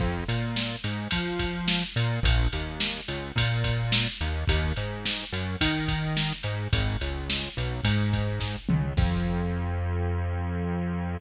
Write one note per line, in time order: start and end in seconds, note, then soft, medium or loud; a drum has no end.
0.00 0.24 F2 loud
0.00 kick medium
0.00 crash medium
0.28 0.76 A#2 medium
0.28 ride medium
0.56 snare medium
0.84 1.08 G#2 medium
0.84 ride medium
1.11 1.84 F3 medium
1.11 kick medium
1.11 ride medium
1.39 kick medium
1.39 ride medium
1.68 snare loud
1.96 2.20 A#2 medium
1.96 ride medium
2.23 2.48 A#1 loud
2.23 kick loud
2.23 ride medium
2.53 3.01 D#2 medium
2.53 ride medium
2.80 snare medium
3.08 3.32 C#2 medium
3.08 ride medium
3.36 4.07 A#2 medium
3.36 kick medium
3.36 ride medium
3.64 kick medium
3.64 ride medium
3.92 snare loud
4.21 4.45 D#2 medium
4.21 ride medium
4.48 4.73 D#2 loud
4.48 kick medium
4.48 ride medium
4.76 5.25 G#2 medium
4.76 ride medium
5.05 snare medium
5.32 5.56 F#2 medium
5.32 ride medium
5.61 6.32 D#3 medium
5.61 kick medium
5.61 ride loud
5.88 kick medium
5.88 ride medium
6.17 snare medium
6.43 6.68 G#2 medium
6.43 ride medium
6.73 6.97 G#1 loud
6.73 kick medium
6.73 ride medium
7.01 7.49 C#2 medium
7.01 ride medium
7.30 snare medium
7.57 7.81 B1 medium
7.57 ride medium
7.84 8.56 G#2 medium
7.84 kick medium
7.84 ride medium
8.13 kick medium
8.13 ride medium
8.40 kick medium
8.40 snare medium
8.69 8.93 C#2 medium
8.69 mid tom medium
8.97 11.17 F2 loud
8.97 kick loud
8.97 crash loud